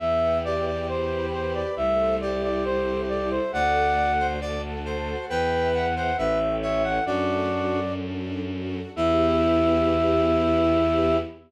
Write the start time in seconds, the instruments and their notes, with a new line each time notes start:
0.00 violin E2, string ensemble 1 B3 B4 E5 G5, flute E5
0.44 string ensemble 1 G4, lead 1 (square) G4, flute D5
0.66 flute D5
0.88 string ensemble 1 E4 B4 G5 B5, flute C5
1.33 string ensemble 1 G4, flute C5
1.54 flute D5
1.76 violin C2, string ensemble 1 A3 A4 C5 E5, flute E5
2.21 string ensemble 1 E4, lead 1 (square) G4, flute D5
2.43 flute D5
2.65 string ensemble 1 C4 E4 A4 E5, flute C5
3.08 string ensemble 1 E4, flute D5
3.31 flute C5
3.53 violin D2, string ensemble 1 A3 A4 D5 F#5, lead 1 (square) D5, flute F#5
3.97 string ensemble 1 F#4
4.19 lead 1 (square) C5
4.41 string ensemble 1 D4 A4 F#5 A5, lead 1 (square) D5
4.85 string ensemble 1 F#4, lead 1 (square) C5
5.29 violin E2, lead 1 (square) B4, string ensemble 1 B4 E5 G5, flute G5
5.74 flute F#5
5.96 lead 1 (square) C5, flute F#5
6.17 violin A1, string ensemble 1 A4 C#5 E5 G5, lead 1 (square) B4, flute E5
6.62 lead 1 (square) C#5, flute E5
6.84 flute F#5
7.06 violin F#2, string ensemble 1 A3 D4 F#4 A4, lead 1 (square) D4 F#4, flute D5
7.50 string ensemble 1 F#4
7.97 string ensemble 1 D4
8.45 string ensemble 1 F#4
8.95 violin E2, string ensemble 1 B3 E4 G4, lead 1 (square) E4, flute E5